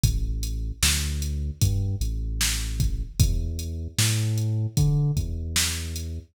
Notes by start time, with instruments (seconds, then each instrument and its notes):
0.03 synth bass 2 A1, kick, closed hi-hat
0.43 closed hi-hat
0.83 synth bass 2 D2, snare
1.22 closed hi-hat
1.61 synth bass 2 G2, kick, closed hi-hat
2.01 synth bass 2 A1, closed hi-hat
2.41 snare
2.80 kick, closed hi-hat
3.20 synth bass 2 E2, kick, closed hi-hat
3.59 closed hi-hat
3.98 synth bass 2 A2, snare
4.38 closed hi-hat
4.77 synth bass 2 D3, kick, closed hi-hat
5.17 synth bass 2 E2, kick, closed hi-hat
5.56 snare
5.96 closed hi-hat